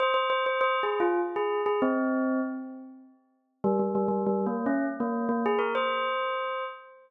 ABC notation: X:1
M:3/4
L:1/16
Q:1/4=99
K:Fm
V:1 name="Tubular Bells"
c c c c (3c2 A2 F2 z A2 A | C4 z8 | G, G, G, G, (3G,2 B,2 D2 z B,2 B, | A B c6 z4 |]